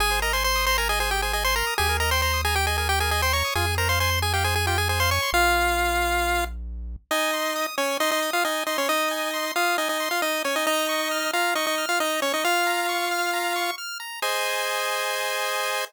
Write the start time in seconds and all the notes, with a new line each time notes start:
0.00 G#1 G#4 G#5
0.11 C5
0.22 A#4 D#5 A#5
0.33 C5 G#5 C6
0.44 C5 C6
0.56 D#6
0.66 C5 A#5 C6
0.78 A#4 G#5 A#5
0.89 G#4 D#5 G#5
1.00 G#4 C5 G#5
1.11 G4 G#4 G5
1.22 G#4 C5 G#5
1.33 G#4 D#5 G#5
1.44 C5 G#5 C6
1.56 A#4 A#5 C6
1.67 D#6
1.78 D#2 G4 G#4 G#5
1.89 A#4
2.00 A#4 D#5 A#5
2.11 C5 G5 C6
2.22 C5 A#5 C6
2.33 D#6
2.45 G#4 G#5 A#5
2.55 G4 G5
2.67 G#4 D#5 G#5
2.78 G#4 A#4 G#5
2.89 G4 G5
3.00 G#4 A#4 G#5
3.11 G#4 D#5 G#5
3.22 C5 G5 C6
3.33 C#5 A#5 C#6
3.45 D#6
3.55 F2 F4 G#4 G#5
3.67 G#4
3.78 A#4 C5 A#5
3.89 C5 F5 C6
4.00 C5 G#5 C6
4.11 C6
4.22 G#4 G#5
4.33 G4 F5 G5
4.44 G#4 C5 G#5
4.55 G#4 G#5
4.67 F4 G4 G5
4.78 G#4 G#5
4.89 G#4 C5 G#5
5.00 C5 F5 C6
5.11 C#5 G#5 C#6
5.22 C6
5.33 A#1 F4 F5
7.11 D#4 D#5 G#5
7.33 C6
7.56 D#6
7.78 C#4 C#5 G#5
8.00 D#4 D#5 C6
8.11 D#4 D#5
8.22 D#6
8.33 F4 F5
8.44 D#4 D#5 G#5
8.67 D#4 D#5 C6
8.78 C#4 C#5
8.89 D#4 D#5 D#6
9.11 G#5
9.34 C6
9.56 F4 F5 D#6
9.78 D#4 D#5 G#5
9.89 D#4 D#5
10.00 C6
10.11 F4 F5
10.22 D#4 D#5 D#6
10.44 C#4 C#5 G#5
10.56 D#4 D#5
10.67 D#4 D#5 A#5
10.89 C#6
11.11 F6
11.33 F4 F5 A#5
11.55 D#4 D#5 C#6
11.67 D#4 D#5
11.78 F6
11.89 F4 F5
12.00 D#4 D#5 A#5
12.22 C#4 C#5 C#6
12.34 D#4 D#5
12.44 F4 F5 F6
12.67 A#5
12.89 C#6
13.11 F6
13.33 A#5
13.56 C#6
13.78 F6
14.00 A#5
14.22 G#4 C5 D#5 G#5